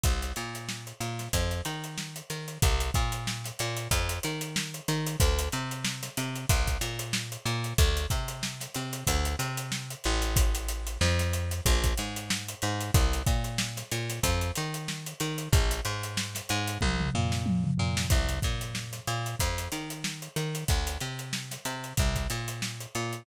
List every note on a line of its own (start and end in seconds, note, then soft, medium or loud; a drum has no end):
0.03 0.33 C2 medium
0.03 kick medium
0.03 closed hi-hat loud
0.22 closed hi-hat medium
0.36 0.93 A#2 medium
0.36 closed hi-hat medium
0.55 closed hi-hat medium
0.69 snare medium
0.87 closed hi-hat medium
1.00 1.28 A#2 medium
1.00 closed hi-hat medium
1.19 snare medium
1.19 closed hi-hat medium
1.33 1.61 F2 loud
1.33 kick medium
1.33 closed hi-hat loud
1.51 closed hi-hat medium
1.65 2.22 D#3 medium
1.65 snare soft
1.65 closed hi-hat medium
1.84 closed hi-hat medium
1.98 snare loud
2.16 closed hi-hat medium
2.30 2.58 D#3 medium
2.30 closed hi-hat medium
2.48 closed hi-hat medium
2.62 2.91 C2 loud
2.62 kick loud
2.62 closed hi-hat loud
2.80 snare soft
2.80 closed hi-hat medium
2.94 3.51 A#2 loud
2.94 kick medium
2.94 snare soft
2.94 closed hi-hat medium
3.12 closed hi-hat medium
3.27 snare loud
3.44 snare medium
3.44 closed hi-hat medium
3.59 3.88 A#2 loud
3.59 closed hi-hat medium
3.77 closed hi-hat medium
3.91 4.19 F2 loud
3.91 kick medium
3.91 closed hi-hat loud
4.09 closed hi-hat medium
4.23 4.81 D#3 medium
4.23 closed hi-hat medium
4.41 closed hi-hat medium
4.56 snare loud
4.74 closed hi-hat medium
4.88 5.16 D#3 loud
4.88 closed hi-hat medium
5.07 closed hi-hat medium
5.20 5.49 D2 loud
5.20 kick loud
5.20 closed hi-hat loud
5.39 closed hi-hat medium
5.52 6.09 C3 medium
5.52 closed hi-hat medium
5.71 closed hi-hat medium
5.85 snare loud
6.03 snare medium
6.03 closed hi-hat medium
6.17 6.46 C3 loud
6.17 closed hi-hat medium
6.35 closed hi-hat medium
6.49 6.78 C2 loud
6.49 kick loud
6.49 closed hi-hat loud
6.67 kick medium
6.67 snare soft
6.67 closed hi-hat medium
6.81 7.37 A#2 medium
6.81 closed hi-hat medium
6.99 closed hi-hat medium
7.13 snare loud
7.32 snare soft
7.32 closed hi-hat medium
7.46 7.74 A#2 loud
7.46 closed hi-hat medium
7.64 closed hi-hat medium
7.78 8.06 D2 loud
7.78 kick loud
7.78 closed hi-hat loud
7.97 snare soft
7.97 closed hi-hat medium
8.10 8.67 C3 medium
8.10 kick medium
8.10 closed hi-hat medium
8.28 closed hi-hat medium
8.43 snare loud
8.60 snare medium
8.60 closed hi-hat medium
8.74 9.04 C3 medium
8.74 snare soft
8.74 closed hi-hat medium
8.93 closed hi-hat medium
9.07 9.36 D2 loud
9.07 kick medium
9.07 closed hi-hat loud
9.25 closed hi-hat medium
9.39 9.95 C3 medium
9.39 snare soft
9.39 closed hi-hat medium
9.57 closed hi-hat medium
9.72 snare loud
9.90 closed hi-hat medium
10.04 10.98 A1 loud
10.04 closed hi-hat medium
10.22 closed hi-hat medium
10.36 kick loud
10.36 closed hi-hat loud
10.55 closed hi-hat medium
10.69 closed hi-hat medium
10.87 closed hi-hat medium
11.01 11.61 F2 loud
11.01 snare loud
11.19 snare medium
11.19 closed hi-hat medium
11.33 closed hi-hat medium
11.51 closed hi-hat medium
11.66 11.94 A#1 loud
11.66 kick medium
11.66 closed hi-hat loud
11.84 kick medium
11.84 closed hi-hat medium
11.97 12.55 G#2 medium
11.97 closed hi-hat medium
12.16 closed hi-hat medium
12.30 snare loud
12.49 closed hi-hat medium
12.62 12.91 G#2 loud
12.62 closed hi-hat medium
12.81 closed hi-hat medium
12.94 13.22 C2 loud
12.94 kick loud
12.94 closed hi-hat loud
13.13 closed hi-hat medium
13.26 13.83 A#2 medium
13.26 kick loud
13.26 closed hi-hat medium
13.44 closed hi-hat medium
13.58 snare loud
13.77 snare medium
13.77 closed hi-hat medium
13.92 14.20 A#2 medium
13.92 closed hi-hat medium
14.09 snare soft
14.09 closed hi-hat medium
14.23 14.51 F2 loud
14.23 kick medium
14.23 closed hi-hat loud
14.41 closed hi-hat medium
14.55 15.14 D#3 medium
14.55 closed hi-hat medium
14.74 closed hi-hat medium
14.88 snare loud
15.06 closed hi-hat medium
15.20 15.49 D#3 loud
15.20 closed hi-hat medium
15.38 closed hi-hat medium
15.53 15.81 A#1 loud
15.53 kick loud
15.53 closed hi-hat loud
15.71 closed hi-hat medium
15.85 16.41 G#2 medium
15.85 closed hi-hat medium
16.03 closed hi-hat medium
16.17 snare loud
16.35 snare medium
16.35 closed hi-hat medium
16.49 16.78 G#2 loud
16.49 closed hi-hat medium
16.67 closed hi-hat medium
16.81 17.10 C2 loud
16.81 kick medium
16.81 high tom medium
17.00 mid tom medium
17.14 17.71 A#2 loud
17.14 floor tom medium
17.32 snare medium
17.46 high tom medium
17.64 mid tom medium
17.78 18.07 A#2 medium
17.78 floor tom medium
17.97 snare loud
18.10 18.39 C2 loud
18.10 kick loud
18.10 closed hi-hat medium
18.29 snare soft
18.29 closed hi-hat medium
18.42 19.00 A#2 medium
18.42 kick medium
18.42 snare soft
18.42 closed hi-hat medium
18.61 closed hi-hat medium
18.75 snare loud
18.93 snare medium
18.93 closed hi-hat medium
19.07 19.35 A#2 medium
19.07 closed hi-hat medium
19.26 closed hi-hat medium
19.40 19.68 F2 loud
19.40 kick medium
19.40 closed hi-hat medium
19.58 closed hi-hat medium
19.72 20.28 D#3 medium
19.72 closed hi-hat medium
19.90 closed hi-hat medium
20.04 snare loud
20.22 closed hi-hat medium
20.36 20.64 D#3 medium
20.36 closed hi-hat medium
20.55 closed hi-hat medium
20.68 20.98 D2 loud
20.68 kick loud
20.68 closed hi-hat medium
20.87 closed hi-hat medium
21.00 21.57 C3 medium
21.00 closed hi-hat medium
21.19 closed hi-hat medium
21.33 snare loud
21.51 snare medium
21.51 closed hi-hat medium
21.65 21.93 C3 medium
21.65 closed hi-hat medium
21.84 closed hi-hat medium
21.97 22.27 C2 medium
21.97 kick loud
21.97 closed hi-hat medium
22.16 kick medium
22.16 snare soft
22.16 closed hi-hat medium
22.30 22.86 A#2 medium
22.30 closed hi-hat medium
22.48 closed hi-hat medium
22.62 snare loud
22.81 snare soft
22.81 closed hi-hat medium
22.95 23.23 A#2 medium
22.95 closed hi-hat medium
23.13 closed hi-hat medium